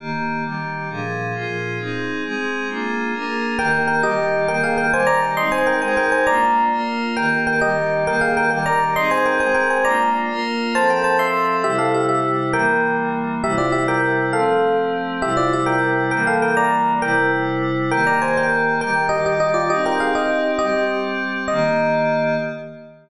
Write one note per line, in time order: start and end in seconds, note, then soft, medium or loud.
0.00 0.44 D#3 medium
0.00 0.45 A#3 medium
0.00 0.44 G4 medium
0.45 0.89 D#3 medium
0.45 0.89 G3 medium
0.45 0.89 G4 medium
0.90 1.34 A#2 medium
0.90 1.34 F3 medium
0.90 1.34 D4 medium
0.90 1.34 G#4 medium
1.34 1.78 A#2 medium
1.34 1.78 F3 medium
1.34 1.78 F4 medium
1.34 1.78 G#4 medium
1.79 2.23 C4 medium
1.79 2.23 D#4 medium
1.79 2.23 G#4 medium
2.24 2.68 G#3 medium
2.24 2.68 C4 medium
2.24 2.68 G#4 medium
2.69 3.13 A#3 medium
2.69 3.13 D4 medium
2.69 3.13 F4 medium
2.69 3.13 G#4 medium
3.14 3.58 A#3 medium
3.14 3.58 D4 medium
3.14 3.58 G#4 medium
3.14 3.58 A#4 medium
3.58 4.02 D#3 medium
3.58 4.03 A#3 medium
3.58 4.02 G4 medium
3.58 3.72 A#4 medium
3.58 3.72 G5 loud
3.88 4.00 A#4 medium
3.88 4.00 G5 medium
4.03 4.47 D#3 medium
4.03 4.47 G3 medium
4.03 4.47 G4 medium
4.03 4.46 G4 medium
4.03 4.46 D#5 loud
4.48 4.92 D#3 medium
4.48 4.92 A#3 medium
4.48 4.92 G4 medium
4.48 4.61 A#4 medium
4.48 4.61 G5 loud
4.63 4.76 G#4 medium
4.63 4.76 F5 medium
4.78 4.91 A#4 medium
4.78 4.91 G5 medium
4.93 5.37 D#3 medium
4.93 5.37 G3 loud
4.93 5.37 G4 medium
4.93 5.06 C5 medium
4.93 5.06 G#5 loud
5.07 5.19 D5 loud
5.07 5.19 A#5 loud
5.37 5.82 G#3 medium
5.37 5.82 C4 medium
5.37 5.82 D#4 medium
5.37 5.49 D#5 medium
5.37 5.49 C6 loud
5.52 5.65 C5 medium
5.52 5.65 G#5 medium
5.67 5.79 A#4 medium
5.67 5.79 G5 medium
5.82 6.27 G#3 medium
5.82 6.27 D#4 medium
5.82 6.27 G#4 medium
5.82 5.95 C5 medium
5.82 5.95 G#5 medium
5.97 6.11 A#4 medium
5.97 6.11 G5 medium
6.12 6.25 C5 medium
6.12 6.25 G#5 medium
6.27 6.71 A#3 loud
6.27 6.71 D4 medium
6.27 6.71 F4 medium
6.27 6.64 D5 loud
6.27 6.64 A#5 loud
6.72 7.16 A#3 medium
6.72 7.16 F4 medium
6.72 7.16 A#4 medium
7.16 7.61 D#3 medium
7.16 7.61 A#3 medium
7.16 7.61 G4 medium
7.16 7.29 A#4 medium
7.16 7.29 G5 medium
7.47 7.60 A#4 medium
7.47 7.60 G5 medium
7.61 8.05 D#3 medium
7.61 8.06 G3 medium
7.61 8.05 G4 medium
7.61 8.04 G4 medium
7.61 8.04 D#5 medium
8.06 8.50 D#3 medium
8.06 8.50 A#3 medium
8.06 8.50 G4 medium
8.06 8.21 A#4 medium
8.06 8.21 G5 loud
8.21 8.34 G#4 medium
8.21 8.34 F5 medium
8.37 8.49 A#4 medium
8.37 8.49 G5 loud
8.50 8.95 D#3 medium
8.50 8.95 G3 medium
8.50 8.95 G4 medium
8.50 8.63 A#4 medium
8.50 8.63 G5 medium
8.66 8.80 D5 medium
8.66 8.80 A#5 medium
8.96 9.40 C4 medium
8.96 9.40 D#4 medium
8.96 9.40 G#4 medium
8.96 9.11 D#5 medium
8.96 9.11 C6 loud
9.11 9.24 C5 medium
9.11 9.24 G#5 medium
9.26 9.38 A#4 medium
9.26 9.38 G5 medium
9.40 9.85 G#3 medium
9.40 9.85 C4 medium
9.40 9.85 G#4 medium
9.40 9.53 C5 medium
9.40 9.53 G#5 medium
9.54 9.69 A#4 medium
9.54 9.69 G5 medium
9.70 9.84 C5 medium
9.70 9.84 G#5 medium
9.85 10.29 A#3 medium
9.85 10.29 D4 medium
9.85 10.29 F4 medium
9.85 10.10 D5 loud
9.85 10.10 A#5 loud
10.30 10.74 A#3 medium
10.30 10.74 F4 medium
10.30 10.74 A#4 loud
10.75 11.63 F3 medium
10.75 11.63 C4 medium
10.75 11.63 A4 medium
10.75 10.89 C5 medium
10.75 10.89 A5 loud
10.90 11.03 A#4 medium
10.90 11.03 G5 medium
11.04 11.16 C5 medium
11.04 11.16 A5 medium
11.19 11.55 E5 medium
11.19 11.55 C6 loud
11.64 12.53 C3 medium
11.64 12.53 G3 medium
11.64 12.53 E4 medium
11.64 11.78 G4 loud
11.64 11.78 E5 loud
11.78 11.93 A4 medium
11.78 11.93 F5 medium
11.94 12.07 G4 medium
11.94 12.07 E5 medium
12.09 12.37 G4 medium
12.09 12.37 E5 medium
12.53 13.42 E3 medium
12.53 13.42 G3 medium
12.53 13.42 A#3 medium
12.53 12.96 A#4 medium
12.53 12.96 G5 loud
13.43 14.32 C3 medium
13.43 14.32 G3 medium
13.43 14.32 E4 medium
13.43 13.56 G4 medium
13.43 13.56 E5 loud
13.58 13.70 F4 medium
13.58 13.70 D5 medium
13.72 13.85 G4 medium
13.72 13.85 E5 medium
13.88 14.26 A#4 medium
13.88 14.26 G5 medium
14.33 15.22 F3 medium
14.33 15.22 A3 medium
14.33 15.22 C4 medium
14.33 14.76 A4 medium
14.33 14.76 F5 loud
15.22 16.11 C3 medium
15.22 16.11 G3 medium
15.22 16.11 E4 medium
15.22 15.35 G4 medium
15.22 15.35 E5 loud
15.37 15.50 F4 medium
15.37 15.50 D5 medium
15.53 15.67 G4 medium
15.53 15.67 E5 medium
15.66 16.03 A#4 medium
15.66 16.03 G5 medium
16.11 17.00 E3 medium
16.11 17.00 G3 medium
16.11 17.00 A#3 medium
16.11 16.25 A#4 medium
16.11 16.25 G5 loud
16.27 16.42 A4 medium
16.27 16.42 F5 medium
16.42 16.55 A#4 medium
16.42 16.55 G5 medium
16.57 16.93 D5 medium
16.57 16.93 A#5 loud
17.01 17.90 C3 medium
17.01 17.90 G3 medium
17.01 17.90 E4 medium
17.01 17.31 A#4 loud
17.01 17.31 G5 loud
17.91 18.80 D#3 medium
17.91 18.80 A#3 medium
17.91 18.80 G4 medium
17.91 18.04 A#4 medium
17.91 18.04 G5 loud
18.07 18.19 D5 medium
18.07 18.19 A#5 medium
18.22 18.35 C5 medium
18.22 18.35 G#5 medium
18.37 18.75 A#4 medium
18.37 18.75 G5 loud
18.81 19.69 D#3 medium
18.81 19.69 G3 medium
18.81 19.69 G4 medium
18.81 18.95 A#4 loud
18.81 18.95 G5 loud
19.09 19.21 G4 medium
19.09 19.21 D#5 loud
19.26 19.38 G4 medium
19.26 19.38 D#5 medium
19.40 19.52 G4 medium
19.40 19.52 D#5 loud
19.54 19.67 F4 medium
19.54 19.67 D5 medium
19.70 20.59 C4 medium
19.70 20.59 D#4 medium
19.70 19.83 G4 medium
19.70 20.59 G4 medium
19.70 19.83 D#5 loud
19.86 19.98 A#4 medium
19.86 19.98 G5 medium
20.00 20.13 G#4 medium
20.00 20.13 F5 medium
20.15 20.51 G4 medium
20.15 20.51 D#5 medium
20.59 21.49 G3 medium
20.59 21.49 C4 medium
20.59 20.85 G4 medium
20.59 21.49 G4 medium
20.59 20.85 D#5 loud
21.48 22.37 D#3 loud
21.48 22.37 A#3 medium
21.48 22.37 G4 loud
21.48 22.35 D#5 loud